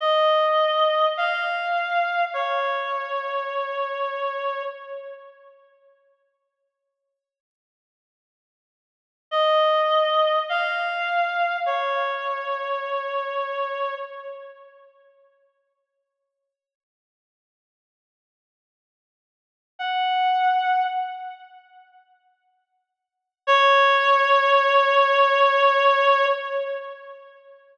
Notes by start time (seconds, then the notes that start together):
0.00 D#5
1.17 F5
2.33 C#5
9.31 D#5
10.49 F5
11.66 C#5
19.79 F#5
23.47 C#5